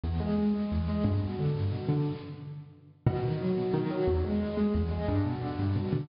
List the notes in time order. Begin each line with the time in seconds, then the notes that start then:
0.04 E2
0.20 G#3
0.38 G#3
0.54 G#3
0.71 E2
0.88 G#3
1.04 G2
1.22 B2
1.39 D3
1.55 G2
1.71 B2
1.89 D3
3.07 B2
3.23 D#3
3.41 F#3
3.57 B2
3.74 D#3
3.90 F#3
4.07 E2
4.24 G#3
4.40 G#3
4.57 G#3
4.74 E2
4.91 G#3
5.08 G2
5.25 B2
5.41 D3
5.59 G2
5.76 B2
5.93 D3